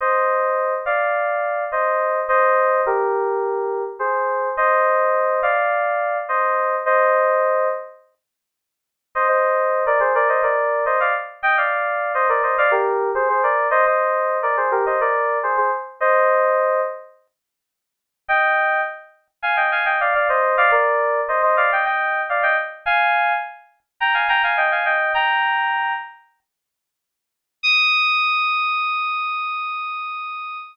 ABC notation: X:1
M:4/4
L:1/16
Q:1/4=105
K:Eb
V:1 name="Electric Piano 2"
[ce]6 [df]6 [ce]4 | [ce]4 [GB]8 [Ac]4 | [ce]6 [df]6 [ce]4 | [ce]6 z10 |
[ce] [ce]4 [Bd] [Ac] [Bd] [ce] [Bd]3 [ce] [df] z2 | [eg] [df]4 [ce] [Bd] [ce] [df] [GB]3 [Ac] [Ac] [Bd]2 | [ce] [ce]4 [Bd] [Ac] [GB] [ce] [Bd]3 [Ac] [Ac] z2 | [ce]6 z10 |
[eg]4 z4 [fa] [eg] [fa] [eg] [df] [df] [ce]2 | [df] [Bd]4 [ce] [ce] [df] [eg] [eg]3 [df] [eg] z2 | [fa]4 z4 [gb] [fa] [gb] [fa] [eg] [fa] [eg]2 | "^rit." [gb]6 z10 |
e'16 |]